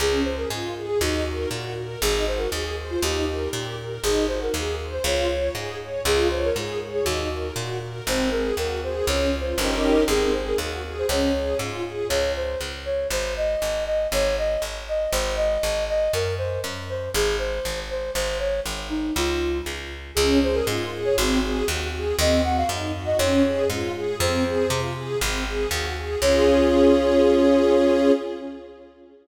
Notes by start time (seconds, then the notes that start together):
0.00 C#2 C#4 G#4
0.24 G#4 C5
0.37 A#4
0.50 G#2 F4
0.76 G#4
0.86 G#4
1.01 D#2 D#4 F#4
1.26 A#4
1.51 A#2 F#4
1.77 A#4
2.01 G#1 D#4 G#4
2.27 F#4 C5
2.38 A#4
2.52 D#2 G#4
2.77 C5
2.90 F4
3.02 D#2 D#4 G4
3.28 A#4
3.53 A#2 G4
3.78 A#4
4.03 G#1 D#4 G#4
4.28 F#4 C5
4.42 A#4
4.54 D#2 G#4
4.79 C5
4.92 C5
5.04 C#2 F4 C#5
5.30 C#5
5.55 G#2 G#4
5.80 C#5
6.05 C#2 F4 G#4
6.30 C5 C#5
6.44 A#4
6.56 G#2 G#4
6.81 C#5
6.93 G#4
7.04 D#2 D#4 F#4
7.31 A#4
7.56 A#2 F#4
7.81 A#4
8.07 G#1 C4 C5
8.31 G#4 A#4
8.57 D#2 F#4 A#4
8.83 G#4 C5
9.06 C#2 C#4 C#5
9.33 F4
9.40 C5
9.58 G1 C#4 D#4 G4 A#4
9.76 A#4
10.08 G#1 C4 G#4
10.33 G#4 C5
10.47 A#4
10.58 D#2 F#4
10.84 G#4
10.99 C5
11.09 C#2 C#4 C#5
11.35 G#4
11.59 G#2 F4
11.84 G#4
12.09 C#2 C#5
12.36 C5
12.61 C#2
12.85 C#5
13.11 G#1 C5
13.37 D#5
13.62 G#1
13.86 D#5
14.12 G#1 C#5
14.38 D#5
14.62 G#1
14.88 D#5
15.12 G#1 C5
15.36 D#5
15.63 G#1
15.89 D#5
16.13 F#2 A#4
16.38 C5
16.64 F#2
16.89 C5
17.14 G#1 G#4
17.39 C5
17.65 G#1
17.90 C5
18.14 G#1 C5
18.39 C#5
18.66 G#1
18.90 D#4
19.16 C#2 F4
19.66 C#2
20.15 C#2 C#4 G#4
20.42 G#4 C5
20.55 A#4
20.67 G#2 F4
20.92 G#4
21.05 C#5
21.17 G#1 C4 F#4
21.42 G#4
21.68 D#2 F#4
21.93 G#4
22.18 D#2 C4 D#5
22.44 F#4 F#5
22.57 F5
22.69 F#2 D#4
22.95 F#4
23.05 D#5
23.18 F2 C#4 C#5
23.44 G#4
23.70 G#2 F4
23.95 G#4
24.20 F2 C4 C5
24.45 G#4
24.70 C3 F4
24.96 G#4
25.21 G#1 C4
25.46 G#4
25.71 D#2 F#4
25.97 G#4
26.21 C#2 C#4 F4 G#4 C#5